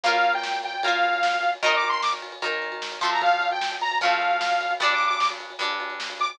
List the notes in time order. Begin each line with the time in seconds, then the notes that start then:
0.03 A#3 F4 F5, kick, crash
0.08 A#4
0.14 ride
0.24 ride
0.34 G5, ride
0.43 snare
0.53 ride
0.63 G5, ride
0.73 ride
0.83 A#3 F4 F5, kick, ride
0.88 A#4
0.93 ride
1.03 ride
1.13 ride
1.23 snare
1.33 ride
1.43 ride
1.53 ride
1.63 D#3 D#4 A#4 D#5, kick, ride
1.73 D6, ride
1.83 ride
1.89 C6, ride
2.02 D6, snare
2.12 ride
2.22 ride
2.32 ride
2.42 D#3 D#4 A#4, kick, ride
2.52 ride
2.62 ride
2.72 ride
2.82 snare
2.92 ride
3.01 F3 A3 C4 C6, kick, ride
3.12 A#5, ride
3.22 F5, kick, ride
3.32 ride
3.41 ride
3.51 G5, ride
3.61 snare
3.71 ride
3.81 A#5, ride
3.91 ride
4.01 F3 A3 C4 F5, kick, ride
4.11 ride
4.21 ride
4.31 ride
4.41 snare
4.51 ride
4.61 ride
4.71 ride
4.80 G2 G3 D4 D5, kick, ride
4.90 D6, ride
5.00 ride
5.07 D6, ride
5.20 D6, snare
5.30 ride
5.40 ride
5.50 ride
5.59 G2 G3 D4, kick, ride
5.70 ride
5.80 ride
5.90 ride
6.00 snare
6.10 ride
6.20 D6, ride
6.30 D6, ride